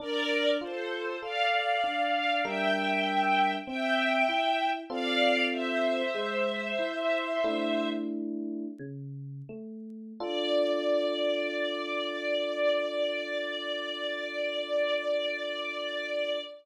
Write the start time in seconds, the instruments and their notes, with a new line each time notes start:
0.00 electric piano 1 D4, string ensemble 1 A#4 D5
0.61 electric piano 1 F4, string ensemble 1 A4 C5
1.21 electric piano 1 A4, string ensemble 1 D5 F5
1.84 electric piano 1 D4
2.44 electric piano 1 G3 D4 A#4, string ensemble 1 E5 G5
3.67 electric piano 1 C4, string ensemble 1 E5 G5
4.29 electric piano 1 E4
4.90 electric piano 1 C4 F4 A4, string ensemble 1 D5 F5
5.52 string ensemble 1 C5 E5
6.15 electric piano 1 G#3
6.79 electric piano 1 E4
7.44 electric piano 1 A3 D4 E4
8.79 electric piano 1 C#3
9.49 electric piano 1 A3
10.20 electric piano 1 D4 F4 A4, string ensemble 1 D5